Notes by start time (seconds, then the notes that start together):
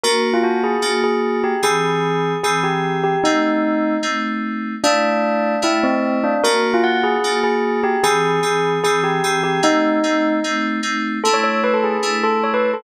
0.04 A#3 D4 F#4 A#4
0.34 F4
0.44 F#4
0.64 G#4
0.82 A#3 D4 F#4
1.04 G#4
1.44 G4
1.63 E3 C4 G#4
2.44 E3 C4 G#4
2.64 G4
3.04 G4
3.24 A3 C4 D#4
4.03 A3 C4 D#4
4.84 A3 D4 E4
5.62 A3 D4 E4
5.84 C4
6.24 D4
6.44 A#3 D4 F#4 A#4
6.74 F4
6.84 F#5
7.04 G#4
7.24 A#3 D4 F#4
7.44 G#4
7.84 G4
8.04 E3 C4 G#4
8.43 E3 C4 G#4
8.84 E3 C4 G#4
9.04 G4
9.24 E3 C4 G#4
9.44 G4
9.63 A3 C4 D#4
10.04 A3 C4 D#4
10.44 A3 C4 D#4
10.83 A3 C4 D#4
11.24 A3 D4 E4 A4
11.34 C#5
11.44 C#5
11.64 B4
11.74 A4
11.84 G#4
12.03 A3 D4 E4
12.24 A4
12.44 C#5
12.54 B4
12.74 A4